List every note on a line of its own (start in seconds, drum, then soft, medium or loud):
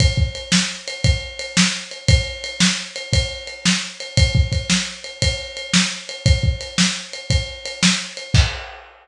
0.00 kick loud
0.00 ride loud
0.17 kick medium
0.35 ride medium
0.52 snare loud
0.88 ride medium
1.04 kick loud
1.04 ride loud
1.39 ride medium
1.57 snare loud
1.91 ride medium
2.08 kick loud
2.08 ride loud
2.44 ride medium
2.60 snare loud
2.96 ride medium
3.13 kick medium
3.13 ride loud
3.47 ride medium
3.65 snare loud
4.00 ride medium
4.17 kick loud
4.17 ride loud
4.35 kick loud
4.52 kick medium
4.52 ride medium
4.70 snare loud
5.04 ride medium
5.22 kick medium
5.22 ride loud
5.57 ride medium
5.73 snare loud
6.09 ride medium
6.26 kick loud
6.26 ride loud
6.43 kick medium
6.61 ride medium
6.78 snare loud
7.13 ride medium
7.30 kick medium
7.30 ride loud
7.65 ride medium
7.83 snare loud
8.17 ride medium
8.34 kick loud
8.34 crash loud